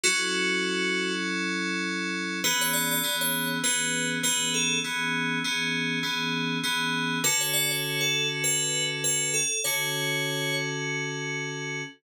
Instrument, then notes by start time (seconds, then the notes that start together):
electric piano 2
0.04 F#3 C#4 E4 F#4 A4
2.44 E3 B3 C#4 G#4 B4
2.61 C#5
2.73 D5
2.91 D5
3.03 E3 B3 C#4 G#4
3.21 C#5
3.63 E3 B3 C#4 G#4 B4
4.23 E3 B3 C#4 G#4 B4
4.54 A4
4.84 E3 B3 C#4 G#4
5.44 E3 B3 C#4 G#4
6.03 E3 B3 C#4 G#4
6.63 E3 B3 C#4 G#4
7.24 D3 C#4 F#4 A4 B4
7.41 C#5
7.53 D5
7.71 C#5
8.01 A4
8.44 B4
9.04 B4
9.34 A4
9.64 D3 C#4 F#4 A4 C#5